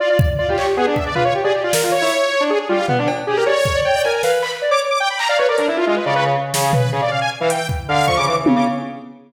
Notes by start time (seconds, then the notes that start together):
0.00 F4 D5
0.09 F4 D5
0.19 D5, kick
0.38 F4 D5
0.48 F4 G4
0.58 C#5, clap
0.77 B3 G#4
0.87 D4 G#4
0.96 E5, kick
1.06 D5
1.15 F4 B4, floor tom
1.25 C#5
1.35 G4
1.44 G#4 D5
1.54 G4
1.63 F4 D5
1.73 A#4, snare
1.83 F4
1.92 C#5
2.02 E4
2.40 D4
2.50 G#4
2.60 G#4
2.69 G3 F4
2.88 B3, floor tom
2.98 D4
3.08 cowbell
3.27 G4 G#4
3.37 A#4
3.46 C#5 D5
3.65 kick
3.75 D5
3.85 C#5 G5
3.95 D5
4.04 A#4 G#5
4.13 G#5
4.23 B4 F5, snare
4.42 B5, clap
4.62 D5
4.71 C#5 D6
4.90 D6
5.00 G5
5.10 B5
5.19 A#5, clap
5.29 D5 F5
5.38 B4 C#5
5.48 A#4 D5
5.58 D4 A#4, closed hi-hat
5.67 E4
5.77 F4
5.87 G#3 F4
5.96 B4
6.06 C#3 D5
6.15 C#3 B4
6.25 C#3
6.54 C#3, snare
6.63 G#4
6.73 B4, floor tom
6.92 C#3 G#4
7.02 D5
7.11 F5
7.21 G#5
7.40 E3 F5
7.50 G5, closed hi-hat
7.69 kick
7.88 D3 F5
8.07 F3 C#6, kick
8.17 C#3 D6
8.27 E3 D6
8.46 C#3, high tom
8.56 C#3 D6